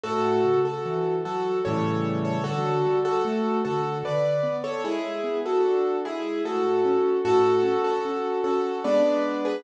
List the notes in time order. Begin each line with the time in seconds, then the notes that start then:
0.04 A2 F#4 A4
0.45 C#3
0.65 F#4 A4
0.86 E3
1.25 F#3 F#4 A4
1.65 A2 C#3 E3 G3 A4 C#5
2.25 A4 C#5
2.44 D3 F#4 A4
2.85 G3
3.05 F#4 A4
3.25 A3
3.65 D3 F#4 A4
4.04 D3 B4 D5
4.43 B3
4.64 A4 C#5
4.84 G#3 E4 G#4
5.24 B3
5.46 F#4 A4
5.64 D4
6.05 G#3 E4 G#4
6.45 A2 F#4 A4
6.85 C#4
7.25 A2 F#4 A4
7.63 C#4
7.84 F#4 A4
8.05 C#4
8.44 C#4 F#4 A4
8.84 G#3 B3 D4 B4 D5
9.45 G#4 B4